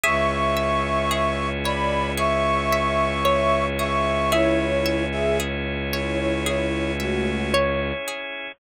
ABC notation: X:1
M:4/4
L:1/16
Q:1/4=56
K:C#phr
V:1 name="Flute"
[ec']6 [db]2 [ec']6 [ec']2 | [Ec]3 [Ge] z2 [Ec] [Ec] [Ec]2 [A,F]2 z4 |]
V:2 name="Pizzicato Strings"
e12 c4 | e12 c4 |]
V:3 name="Pizzicato Strings"
G2 e2 G2 c2 G2 e2 c2 G2 | G2 e2 G2 c2 G2 e2 c2 G2 |]
V:4 name="Violin" clef=bass
C,,16- | C,,16 |]
V:5 name="Drawbar Organ"
[CEG]16- | [CEG]16 |]